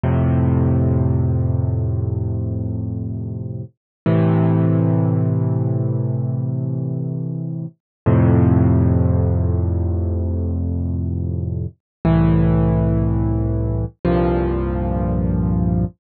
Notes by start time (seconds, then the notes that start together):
0.04 F2 A2 C3
4.06 A2 C3 E3
8.06 F2 A2 C3
12.05 C2 A2 E3
14.05 C2 G2 A#2 F3